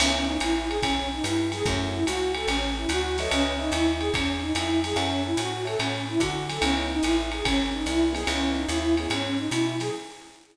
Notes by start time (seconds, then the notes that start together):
0.00 C#2 B3 C#4 D#4 E4, crash, ride
0.28 D#4
0.40 A1 E4, hi-hat pedal, ride
0.68 G#4, ride
0.82 B1 C#4, kick, ride
1.13 D#4
1.24 G2 E4, hi-hat pedal, ride
1.52 G#4, snare, ride
1.65 F#2 A3 C#4 E4 F#4, kick, ride
1.93 E4
2.06 C#2 F#4, hi-hat pedal, ride
2.34 A4, ride
2.47 A1 C#4, ride
2.77 E4
2.89 D2 F#4, hi-hat pedal, ride
3.18 A4 B4 C#5 D#5 E5, snare, ride
3.31 C#2 C#4, ride
3.59 D#4 B4 C#5 D#5 E5
3.72 D#2 E4, hi-hat pedal, ride
4.00 G#4, ride
4.14 E2 C#4, kick, ride
4.41 D#4
4.55 F2 E4, hi-hat pedal, ride
4.84 G#4, snare, ride
4.96 F#2 C#4 A4 C#5 E5 F#5, ride
5.26 E4
5.37 A2 F#4, hi-hat pedal, ride
5.65 A4 C#5 E5 F#5, ride
5.79 A2 C#4, ride
6.09 E4
6.19 D3 F#4, kick, hi-hat pedal, ride
6.49 A4, snare, ride
6.61 C#2 B3 C#4 D#4 E4, ride
6.91 D#4
7.03 A1 E4, hi-hat pedal, ride
7.32 G#4, ride
7.44 G#1 C#4, kick, ride
7.73 D#4
7.86 C2 E4, hi-hat pedal, ride
8.13 B3 C#4 D#4 E4 G#4, snare, ride
8.26 C#2 B3 C#4 D#4 E4, ride
8.57 D#4
8.68 D#2 E4, hi-hat pedal, ride
8.97 B3 C#4 D#4 E4 G#4, ride
9.10 G#2 C#4, ride
9.39 D#4
9.51 B2 E4, hi-hat pedal, ride
9.80 G#4, snare, ride